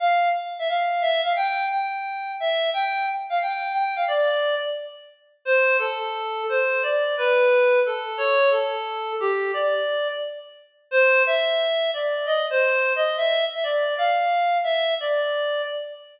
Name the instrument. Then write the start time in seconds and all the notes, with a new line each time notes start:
clarinet
0.00 F5
0.59 E5
0.69 F5
1.02 E5
1.24 F5
1.36 G5
1.70 G5
2.40 E5
2.74 G5
3.30 F5
3.41 G5
3.73 G5
3.96 F5
4.08 D5
5.45 C5
5.79 A4
6.49 C5
6.83 D5
7.17 B4
7.86 A4
8.18 C#5
8.51 A4
9.20 G4
9.54 D5
10.91 C5
11.26 E5
11.94 D5
12.26 D#5
12.50 C5
12.96 D#5
13.17 E5
13.55 E5
13.64 D5
13.98 F5
14.64 E5
15.00 D5